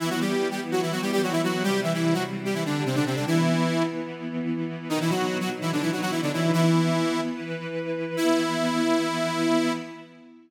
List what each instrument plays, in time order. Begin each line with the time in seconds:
0.00 lead 2 (sawtooth) E3 E4, string ensemble 1 E3 B3 E4
0.10 lead 2 (sawtooth) F#3 F#4
0.21 lead 2 (sawtooth) G3 G4
0.51 lead 2 (sawtooth) G3 G4
0.72 lead 2 (sawtooth) F#3 F#4
0.82 lead 2 (sawtooth) E3 E4
0.92 lead 2 (sawtooth) F#3 F#4
1.02 lead 2 (sawtooth) G3 G4
1.12 lead 2 (sawtooth) G3 G4
1.23 lead 2 (sawtooth) F#3 F#4
1.32 lead 2 (sawtooth) E3 E4
1.43 lead 2 (sawtooth) F#3 F#4
1.63 string ensemble 1 C3 G3 C4, lead 2 (sawtooth) G3 G4
1.83 lead 2 (sawtooth) E3 E4
1.94 lead 2 (sawtooth) E3 E4
2.14 lead 2 (sawtooth) F#3 F#4
2.45 lead 2 (sawtooth) G3 G4
2.54 lead 2 (sawtooth) E3 E4
2.66 lead 2 (sawtooth) D3 D4
2.86 lead 2 (sawtooth) C3 C4
2.95 lead 2 (sawtooth) D3 D4
3.06 lead 2 (sawtooth) C3 C4
3.16 lead 2 (sawtooth) D3 D4
3.27 lead 2 (sawtooth) E3 E4, string ensemble 1 E3 B3 E4
4.89 string ensemble 1 B2 F#3 D#4, lead 2 (sawtooth) D#3 D#4
5.01 lead 2 (sawtooth) E3 E4
5.10 lead 2 (sawtooth) F#3 F#4
5.40 lead 2 (sawtooth) F#3 F#4
5.61 lead 2 (sawtooth) E3 E4
5.72 lead 2 (sawtooth) D3 D4
5.81 lead 2 (sawtooth) E3 E4
5.92 lead 2 (sawtooth) F#3 F#4
6.01 lead 2 (sawtooth) F#3 F#4
6.11 lead 2 (sawtooth) E3 E4
6.22 lead 2 (sawtooth) D3 D4
6.33 lead 2 (sawtooth) E3 E4
6.53 string ensemble 1 E3 B3 E4, lead 2 (sawtooth) E3 E4
7.35 string ensemble 1 E3 E4 B4
8.17 string ensemble 1 E3 B3 E4, lead 2 (sawtooth) E4